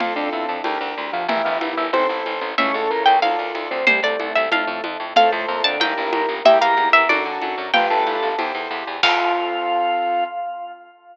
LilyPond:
<<
  \new Staff \with { instrumentName = "Harpsichord" } { \time 2/2 \key f \major \tempo 2 = 93 f''8 r4 a''8 g''2 | e''8 f''4 e''8 c''2 | e''8 r4 g''8 f''2 | c''8 d''4 e''8 f''4. r8 |
f''8 r4 a''8 g''2 | e''8 f''4 e''8 d''2 | g''2~ g''8 r4. | f''1 | }
  \new Staff \with { instrumentName = "Drawbar Organ" } { \time 2/2 \key f \major <f, f>8 <d, d>8 <e, e>8 r2 <f, f>8 | <e, e>4 <e, e>4 <c c'>8 r4. | <cis cis'>8 <a, a>8 <bes, bes>8 r2 <c c'>8 | <g, g>8 <a, a>8 <a, a>4 <a, a>4 r4 |
<a, a>8 <a, a>8 <bes, bes>8 <d d'>8 <bes, bes>2 | <g g'>8 <bes bes'>4 r2 r8 | <f f'>8 <a a'>4. r2 | f'1 | }
  \new Staff \with { instrumentName = "Acoustic Grand Piano" } { \time 2/2 \key f \major <c' f' a'>2 <d' g' bes'>2 | <e' g' bes'>2 <e' a' c''>2 | <e' a' cis''>2 <f' a' d''>2 | r1 |
<f' a' c''>2 <e' g' bes'>2 | <e' g' bes'>2 <d' fis' a'>2 | <d' f' g' b'>2 <e' g' c''>2 | <c' f' a'>1 | }
  \new Staff \with { instrumentName = "Electric Bass (finger)" } { \clef bass \time 2/2 \key f \major f,8 f,8 f,8 f,8 d,8 d,8 d,8 d,8 | g,,8 g,,8 g,,8 g,,8 a,,8 a,,8 a,,8 a,,8 | cis,8 cis,8 cis,8 cis,8 d,8 d,8 d,8 d,8 | c,8 c,8 c,8 c,8 f,8 f,8 f,8 f,8 |
f,8 f,8 f,8 f,8 g,,8 g,,8 g,,8 g,,8 | e,8 e,8 e,8 e,8 fis,8 fis,8 fis,8 fis,8 | g,,8 g,,8 g,,8 g,,8 e,8 e,8 e,8 e,8 | f,1 | }
  \new DrumStaff \with { instrumentName = "Drums" } \drummode { \time 2/2 cgl2 cgho2 | cgl4 cgho4 cgho4 cgho4 | cgl2 cgho4 cgho4 | cgl4 cgho4 cgho4 cgho4 |
cgl2 cgho4 cgho4 | cgl4 cgho4 cgho4 cgho4 | cgl4 cgho4 cgho2 | <cymc bd>2 r2 | }
>>